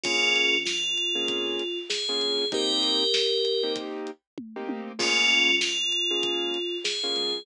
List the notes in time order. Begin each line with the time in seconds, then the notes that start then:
0.03 A#1 A#3 C#4 F4 G#4, kick, closed hi-hat
0.36 closed hi-hat
0.54 A#1
0.65 A#1 F4, snare
0.97 closed hi-hat
1.15 A#1 A#3 C#4 F4 G#4
1.28 F2, kick, closed hi-hat
1.59 closed hi-hat
1.90 G#4, snare
2.09 A#3 C#4 F4 G#4
2.20 A#1, closed hi-hat
2.40 A#1
2.52 A#3 C4 D#4 G4 A#4, kick, closed hi-hat
2.83 closed hi-hat
3.14 snare
3.45 closed hi-hat
3.63 A#3 C4 D#4 G4
3.76 kick, closed hi-hat
4.07 closed hi-hat
4.38 kick, high tom
4.56 A#3 C4 D#4 G4
4.69 high tom
4.99 C#2 A#3 C#4 F4 G#4, kick, crash
5.30 closed hi-hat
5.48 C#2
5.61 C#2 F4, snare
5.92 closed hi-hat
6.11 C#2 A#3 C#4 F4 G#4
6.23 C#2, kick, closed hi-hat
6.54 closed hi-hat
6.84 G#4, snare
7.03 A#3 C#4 F4 G#4
7.16 C#2, closed hi-hat
7.34 C#2